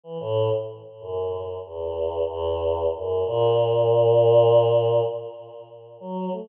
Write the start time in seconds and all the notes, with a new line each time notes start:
0.03 E3
0.20 A2
1.00 F#2
1.65 E2
2.29 E2
2.95 F#2
3.26 A#2
6.00 F#3
6.32 A3